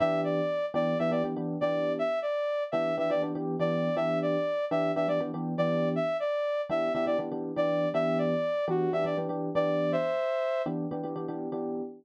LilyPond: <<
  \new Staff \with { instrumentName = "Lead 2 (sawtooth)" } { \time 4/4 \key e \minor \tempo 4 = 121 e''8 d''4 d''8 e''16 d''16 r8. d''8. | e''8 d''4 e''8 e''16 d''16 r8. d''8. | e''8 d''4 e''8 e''16 d''16 r8. d''8. | e''8 d''4 e''8 e''16 d''16 r8. d''8. |
e''8 d''4 fis'8 e''16 d''16 r8. d''8. | <c'' e''>4. r2 r8 | }
  \new Staff \with { instrumentName = "Electric Piano 1" } { \time 4/4 \key e \minor <e b d' g'>4. <e b d' g'>8 <e b d' g'>16 <e b d' g'>16 <e b d' g'>16 <e b d' g'>8 <e b d' g'>8.~ | <e b d' g'>4. <e b d' g'>8 <e b d' g'>16 <e b d' g'>16 <e b d' g'>16 <e b d' g'>8 <e b d' g'>8. | <e b d' g'>4. <e b d' g'>8 <e b d' g'>16 <e b d' g'>16 <e b d' g'>16 <e b d' g'>8 <e b d' g'>8.~ | <e b d' g'>4. <e b d' g'>8 <e b d' g'>16 <e b d' g'>16 <e b d' g'>16 <e b d' g'>8 <e b d' g'>8. |
<e b d' g'>4. <e b d' g'>8 <e b d' g'>16 <e b d' g'>16 <e b d' g'>16 <e b d' g'>8 <e b d' g'>8.~ | <e b d' g'>4. <e b d' g'>8 <e b d' g'>16 <e b d' g'>16 <e b d' g'>16 <e b d' g'>8 <e b d' g'>8. | }
>>